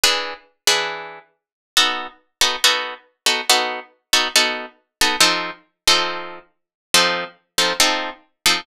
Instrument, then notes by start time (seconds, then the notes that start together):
acoustic guitar (steel)
0.04 E3 D4 G#4 B4
0.67 E3 D4 G#4 B4
1.77 B3 D#4 F#4 A4
2.41 B3 D#4 F#4 A4
2.64 B3 D#4 F#4 A4
3.26 B3 D#4 F#4 A4
3.50 B3 D#4 F#4 A4
4.13 B3 D#4 F#4 A4
4.36 B3 D#4 F#4 A4
5.01 B3 D#4 F#4 A4
5.21 F3 C4 D#4 A4
5.88 F3 C4 D#4 A4
6.94 F3 C4 D#4 A4
7.58 F3 C4 D#4 A4
7.80 F3 C4 D#4 A4
8.46 F3 C4 D#4 A4